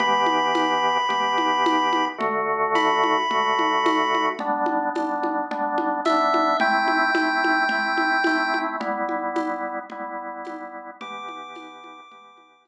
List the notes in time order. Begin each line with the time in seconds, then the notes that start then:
0.00 E3 B3 G4 B5, low conga
0.26 high conga
0.55 tambourine, high conga
1.09 E3 B3 G4, low conga
1.38 high conga
1.66 tambourine, high conga
1.93 high conga
2.18 D3 A3 F#4, low conga
2.75 B5, tambourine, high conga
3.04 high conga
3.30 D3 A3 F#4, low conga
3.59 high conga
3.86 tambourine, high conga
4.15 high conga
4.39 G3 B3 D4, low conga
4.66 high conga
4.95 G3 B3 D4, tambourine, high conga
5.23 high conga
5.51 G3 B3 D4, low conga
5.78 high conga
6.05 G3 B3 D4 E5, tambourine, high conga
6.34 high conga
6.60 A3 C4 E4 G5, low conga
6.88 high conga
7.14 A3 C4 E4, tambourine, high conga
7.44 high conga
7.69 A3 C4 E4, low conga
7.97 high conga
8.24 A3 C4 E4, tambourine, high conga
8.54 high conga
8.80 G3 B3 E4, low conga
9.09 high conga
9.36 tambourine, high conga
9.90 G3 B3 E4, low conga
10.45 tambourine, high conga
11.01 E3 B3 G4 D6, low conga
11.28 high conga
11.55 tambourine, high conga
11.84 high conga
12.11 E3 B3 G4, low conga
12.37 high conga
12.65 tambourine, high conga